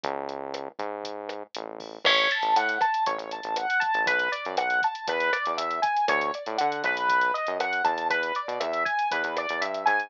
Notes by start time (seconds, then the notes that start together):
0.04 C#2, kick, closed hi-hat
0.29 closed hi-hat
0.54 cross-stick, closed hi-hat
0.79 G#2, kick, closed hi-hat
1.04 kick, closed hi-hat
1.29 cross-stick, closed hi-hat
1.55 A1, closed hi-hat
1.80 kick, open hi-hat
2.05 A1 C#5, kick, cross-stick, crash
2.18 closed hi-hat
2.31 A5, closed hi-hat
2.43 A1, closed hi-hat
2.56 A2 F#5, closed hi-hat
2.69 closed hi-hat
2.81 A5, kick, cross-stick, closed hi-hat
2.94 closed hi-hat
3.06 A1 C#5, kick, closed hi-hat
3.18 A1, closed hi-hat
3.31 A5, closed hi-hat
3.43 A1, closed hi-hat
3.56 F#5, cross-stick, closed hi-hat
3.70 closed hi-hat
3.80 A5, kick, closed hi-hat
3.94 A1, closed hi-hat
4.06 B1 B4, kick, closed hi-hat
4.19 closed hi-hat
4.32 D5, closed hi-hat
4.45 F#2, closed hi-hat
4.57 B1 F#5, cross-stick, closed hi-hat
4.70 closed hi-hat
4.82 A5, kick, closed hi-hat
4.95 closed hi-hat
5.08 E2 B4, kick, closed hi-hat
5.20 closed hi-hat
5.33 D5, cross-stick, closed hi-hat
5.46 E2, closed hi-hat
5.57 E2 E5, closed hi-hat
5.71 closed hi-hat
5.82 G#5, kick, closed hi-hat
5.97 closed hi-hat
6.08 D2 C#5, kick, cross-stick, closed hi-hat
6.21 closed hi-hat
6.34 D5, closed hi-hat
6.46 A2, closed hi-hat
6.58 D3 F#5, closed hi-hat
6.72 closed hi-hat
6.84 B1 B4, kick, cross-stick, closed hi-hat
6.97 closed hi-hat
7.09 kick, closed hi-hat
7.21 closed hi-hat
7.34 D#5, closed hi-hat
7.47 F#2, closed hi-hat
7.59 F#2 F#5, cross-stick, closed hi-hat
7.73 closed hi-hat
7.84 E2 A5, kick, closed hi-hat
7.98 closed hi-hat
8.10 B4, kick, closed hi-hat
8.23 closed hi-hat
8.35 D5, closed hi-hat
8.48 B2, closed hi-hat
8.60 E2 E5, cross-stick, closed hi-hat
8.73 closed hi-hat
8.85 G#5, kick, closed hi-hat
8.99 closed hi-hat
9.11 E2 B4, kick, closed hi-hat
9.24 E2, closed hi-hat
9.37 D5, cross-stick, closed hi-hat
9.49 E2, closed hi-hat
9.61 G2 E5, closed hi-hat
9.74 closed hi-hat
9.86 G#2 G#5, kick, closed hi-hat
10.00 closed hi-hat